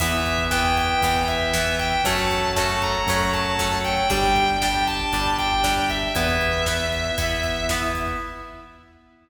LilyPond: <<
  \new Staff \with { instrumentName = "Distortion Guitar" } { \time 4/4 \key e \dorian \tempo 4 = 117 e''4 g''8 g''4 e''4 g''8 | a''4 a''8 bes''4 a''4 g''8 | g''4 g''8 a''4 g''4 e''8 | e''2. r4 | }
  \new Staff \with { instrumentName = "Acoustic Guitar (steel)" } { \time 4/4 \key e \dorian <e b>4 <e b>4 <e b>4 <e b>4 | <fis a cis'>4 <fis a cis'>4 <fis a cis'>4 <fis a cis'>4 | <g d'>4 <g d'>4 <g d'>4 <g d'>4 | <b e'>4 <b e'>4 <b e'>4 <b e'>4 | }
  \new Staff \with { instrumentName = "Drawbar Organ" } { \time 4/4 \key e \dorian <b e'>1 | <a cis' fis'>1 | <d' g'>1 | <b e'>1 | }
  \new Staff \with { instrumentName = "Synth Bass 1" } { \clef bass \time 4/4 \key e \dorian e,2 e,2 | fis,2 fis,2 | g,,2 g,,2 | e,2 e,2 | }
  \new DrumStaff \with { instrumentName = "Drums" } \drummode { \time 4/4 <cymc bd>16 bd16 <hh bd>16 bd16 <bd sn>16 bd16 <hh bd>16 bd16 <hh bd>16 bd16 <hh bd>16 bd16 <bd sn>16 bd16 <hh bd>16 bd16 | <hh bd>16 bd16 <hh bd>16 bd16 <bd sn>16 bd16 <hh bd>16 bd16 <hh bd>16 bd16 <hh bd>16 bd16 <bd sn>16 bd16 <hh bd>16 bd16 | <hh bd>16 bd16 <hh bd>16 bd16 <bd sn>16 bd16 <hh bd>16 bd16 <hh bd>16 bd16 <hh bd>16 bd16 <bd sn>16 bd16 <hh bd>16 bd16 | <hh bd>16 bd16 <hh bd>16 bd16 <bd sn>16 bd16 <hh bd>16 bd16 <hh bd>16 bd16 <hh bd>16 bd16 <bd sn>16 bd16 <hh bd>16 bd16 | }
>>